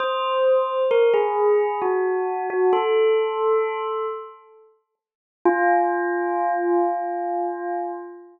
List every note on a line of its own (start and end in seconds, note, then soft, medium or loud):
0.00 0.82 C5 medium
0.91 1.13 A#4 medium
1.14 1.80 G#4 medium
1.82 2.46 F#4 medium
2.50 2.72 F#4 medium
2.73 4.06 A4 medium
5.45 7.92 F4 loud